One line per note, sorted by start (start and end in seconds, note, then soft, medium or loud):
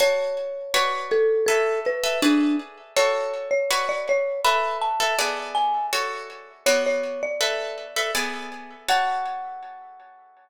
0.00 0.59 F#4 loud
0.00 0.59 C#5 loud
0.00 1.06 C#5 loud
0.00 0.59 A5 loud
0.74 1.33 F#4 loud
0.74 1.33 B4 loud
0.74 1.33 C#5 loud
0.74 1.33 D5 loud
1.12 1.45 A4 loud
1.46 1.80 A4 loud
1.46 1.92 A4 loud
1.46 1.92 B4 loud
1.46 1.92 E5 loud
1.86 2.21 B4 medium
2.04 2.18 A4 loud
2.04 2.18 B4 medium
2.04 2.18 E5 loud
2.22 2.56 D4 loud
2.22 2.82 G#4 loud
2.22 2.82 B4 loud
2.22 2.82 D5 loud
2.96 3.56 F#4 loud
2.96 3.56 A4 loud
2.96 3.49 C#5 loud
2.96 3.56 C#5 loud
3.51 3.87 C#5 medium
3.71 4.30 F#4 loud
3.71 4.30 B4 loud
3.71 4.30 C#5 loud
3.71 4.30 D5 loud
3.89 4.06 D5 medium
4.09 4.41 C#5 loud
4.44 4.89 A4 loud
4.44 4.89 B4 loud
4.44 4.89 E5 loud
4.44 4.78 B5 loud
4.81 5.48 A5 medium
5.00 5.15 A4 loud
5.00 5.15 B4 medium
5.00 5.15 E5 loud
5.19 5.78 B3 loud
5.19 5.78 G#4 loud
5.19 5.78 D5 loud
5.55 5.87 G#5 medium
5.93 6.52 F#4 loud
5.93 6.52 A4 loud
5.93 6.52 C#5 loud
6.66 7.26 B3 loud
6.66 7.26 F#4 loud
6.66 6.84 C#5 medium
6.66 7.26 C#5 loud
6.66 7.26 D5 loud
6.86 7.21 C#5 medium
7.23 8.41 D5 medium
7.41 7.85 A4 loud
7.41 7.85 B4 loud
7.41 7.85 E5 loud
7.96 8.11 A4 medium
7.96 8.11 B4 loud
7.96 8.11 E5 loud
8.15 8.74 B3 loud
8.15 8.74 G#4 loud
8.15 8.74 D5 loud
8.88 10.49 F#4 loud
8.88 10.49 C#5 loud
8.88 10.49 F#5 loud
8.88 10.49 A5 medium